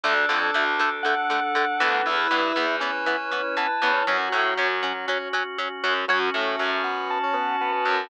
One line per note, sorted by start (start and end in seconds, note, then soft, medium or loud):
0.04 0.25 D2 medium
0.04 0.14 D3 loud
0.04 0.14 A3 loud
0.04 2.01 D4 loud
0.04 0.91 D4 medium
0.04 2.05 D4 medium
0.04 2.01 A4 medium
0.04 2.05 A4 medium
0.29 0.51 F2 medium
0.29 0.39 D3 loud
0.29 0.39 A3 medium
0.54 1.62 D2 medium
0.54 0.64 D3 medium
0.54 0.64 A3 medium
0.79 0.89 D3 medium
0.79 0.89 A3 medium
1.03 1.15 D3 medium
1.03 1.15 A3 medium
1.03 2.02 F#5 medium
1.30 1.40 D3 medium
1.30 1.40 A3 medium
1.55 1.65 D3 loud
1.55 1.65 A3 medium
1.80 2.02 D2 medium
1.80 2.16 E3 loud
1.80 2.16 B3 loud
2.06 2.27 E2 medium
2.06 4.03 E4 medium
2.06 4.05 E4 medium
2.06 2.76 E4 loud
2.06 4.03 B4 medium
2.06 4.05 B4 medium
2.31 2.52 G2 medium
2.31 2.41 E3 medium
2.31 2.41 B3 medium
2.56 3.63 E2 medium
2.56 2.66 E3 medium
2.56 2.66 B3 loud
2.80 2.91 E3 medium
2.80 2.91 B3 medium
2.80 3.68 C#4 medium
3.06 3.16 E3 medium
3.06 3.16 B3 medium
3.32 3.42 E3 medium
3.32 3.42 B3 medium
3.57 3.67 E3 medium
3.57 3.67 B3 medium
3.57 4.04 A5 medium
3.82 4.03 E2 medium
3.82 3.92 E3 medium
3.82 3.92 B3 loud
3.82 3.93 C#4 medium
3.93 4.05 C#4 medium
4.07 4.29 F#2 medium
4.07 4.17 F#3 loud
4.07 5.06 F#3 loud
4.07 6.05 C#4 medium
4.07 6.07 C#4 medium
4.07 4.17 C#4 loud
4.07 6.05 F#4 medium
4.07 6.07 F#4 medium
4.32 4.54 A2 medium
4.32 4.42 F#3 medium
4.32 4.42 C#4 medium
4.57 5.65 F#2 medium
4.57 4.68 F#3 medium
4.57 4.68 C#4 loud
4.83 4.93 F#3 medium
4.83 4.93 C#4 medium
5.07 5.18 F#3 loud
5.07 5.28 C#4 medium
5.07 5.18 C#4 loud
5.33 5.43 F#3 loud
5.33 5.43 C#4 loud
5.58 5.68 F#3 medium
5.58 5.68 C#4 medium
5.84 6.05 F#2 medium
5.84 5.94 F#3 loud
5.84 5.94 C#4 medium
6.08 6.30 F#2 medium
6.08 6.29 F#3 loud
6.08 8.08 C#4 medium
6.08 8.07 C#4 loud
6.08 8.08 F#4 medium
6.08 6.19 F#4 loud
6.08 8.07 F#4 loud
6.08 6.19 C#5 loud
6.34 6.56 A2 medium
6.34 6.55 A3 medium
6.34 6.82 A3 medium
6.59 7.67 F#2 medium
6.59 7.66 F#3 medium
6.84 7.18 B3 medium
7.10 8.09 A5 medium
7.23 7.35 C#4 medium
7.33 7.56 B3 medium
7.61 7.72 B3 loud
7.72 8.05 B3 medium
7.85 8.07 F#2 medium
7.85 8.07 F#3 medium